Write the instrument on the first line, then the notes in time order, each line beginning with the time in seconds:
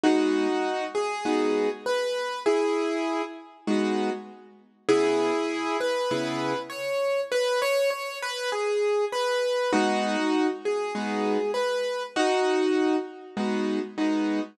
acoustic grand piano
0.04 G#3 B3 D#4 F#4
0.95 G#4
1.25 G#3 B3 D#4 F#4
1.86 B4
2.46 E4 G#4
3.67 G#3 B3 D#4 F#4
4.89 C#3 B3 E4 G#4
5.80 B4
6.11 C#3 B3 E4 G#4
6.70 C#5
7.32 B4
7.62 C#5
7.90 C#5
8.22 B4
8.52 G#4
9.12 B4
9.73 G#3 B3 D#4 F#4
10.65 G#4
10.95 G#3 B3 D#4 F#4
11.54 B4
12.16 D#4 F#4
13.37 G#3 B3 D#4 F#4
13.98 G#3 B3 D#4 F#4